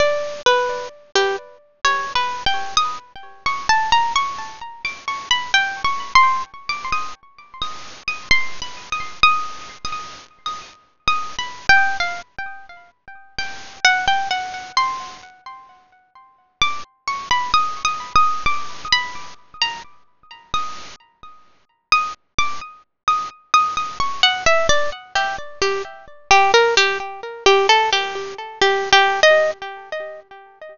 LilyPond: \new Staff { \time 2/4 \tempo 4 = 65 d''8 b'8 r16 g'16 r8 | \tuplet 3/2 { des''8 b'8 g''8 } ees'''16 r8 des'''16 | a''16 bes''16 des'''8. d'''16 des'''16 b''16 | \tuplet 3/2 { g''8 des'''8 c'''8 } r16 d'''16 ees'''16 r16 |
r16 ees'''8 ees'''16 \tuplet 3/2 { c'''8 b''8 ees'''8 } | \tuplet 3/2 { ees'''4 ees'''4 ees'''4 } | \tuplet 3/2 { ees'''8 b''8 g''8 } f''16 r8. | r8 g''8 ges''16 g''16 ges''8 |
c'''2 | d'''16 r16 des'''16 b''16 \tuplet 3/2 { ees'''8 ees'''8 ees'''8 } | d'''8 b''8 r16 bes''16 r8 | r16 ees'''8 r4 ees'''16 |
r16 d'''16 r8 ees'''16 r16 ees'''16 ees'''16 | des'''16 ges''16 e''16 d''16 r16 g'16 r16 g'16 | r8 g'16 bes'16 g'16 r8 g'16 | a'16 g'8 r16 \tuplet 3/2 { g'8 g'8 ees''8 } | }